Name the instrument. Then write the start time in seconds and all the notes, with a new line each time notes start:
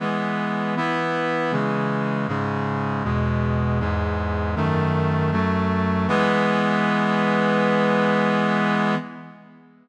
brass section
0.00 E3 G#3 B3
0.77 E3 B3 E4
1.52 C#3 E3 G#3
2.28 G#2 C#3 G#3
3.04 E2 B2 G#3
3.80 E2 G#2 G#3
4.56 F#2 D#3 A3
5.32 F#2 F#3 A3
6.08 E3 G#3 B3